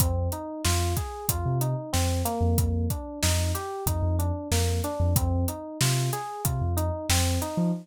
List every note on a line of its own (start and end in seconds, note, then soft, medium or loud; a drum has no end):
0.00 0.29 F2 loud
0.00 0.29 C4 loud
0.00 kick loud
0.00 closed hi-hat loud
0.32 0.62 D#4 medium
0.32 closed hi-hat medium
0.65 0.94 F2 medium
0.65 0.94 F4 loud
0.65 snare loud
0.97 1.26 G#4 medium
0.97 kick medium
0.97 closed hi-hat medium
1.29 1.44 F2 medium
1.29 1.59 F4 loud
1.29 kick medium
1.29 closed hi-hat loud
1.46 1.75 C3 medium
1.61 1.90 D#4 medium
1.61 closed hi-hat medium
1.93 2.23 F2 medium
1.93 2.22 C4 loud
1.93 snare medium
2.25 2.87 A#3 loud
2.25 closed hi-hat medium
2.41 2.55 F2 medium
2.58 2.87 F2 loud
2.58 kick medium
2.58 closed hi-hat medium
2.90 3.19 D4 medium
2.90 kick medium
2.90 closed hi-hat medium
3.23 3.52 F2 medium
3.23 3.52 D#4 medium
3.23 snare loud
3.55 3.84 G4 medium
3.55 closed hi-hat medium
3.86 4.01 F2 medium
3.86 4.16 D#4 loud
3.86 kick medium
3.86 closed hi-hat medium
4.02 4.31 F2 loud
4.19 4.48 D4 medium
4.19 closed hi-hat medium
4.51 4.80 F2 medium
4.51 4.81 A#3 loud
4.51 snare medium
4.84 5.13 D4 loud
4.84 closed hi-hat medium
5.00 5.14 F2 loud
5.16 5.45 F2 loud
5.16 5.45 C4 loud
5.16 kick loud
5.16 closed hi-hat loud
5.48 5.78 D#4 medium
5.48 closed hi-hat medium
5.81 6.10 C3 medium
5.81 6.10 F4 medium
5.81 snare loud
6.13 6.42 G#4 medium
6.13 closed hi-hat medium
6.45 6.60 C3 medium
6.45 6.74 F4 medium
6.45 kick medium
6.45 closed hi-hat medium
6.61 6.90 F2 medium
6.77 7.06 D#4 loud
6.77 closed hi-hat medium
7.09 7.38 F2 medium
7.09 7.39 C4 loud
7.09 snare loud
7.42 7.71 D#4 medium
7.42 closed hi-hat medium
7.57 7.72 F3 medium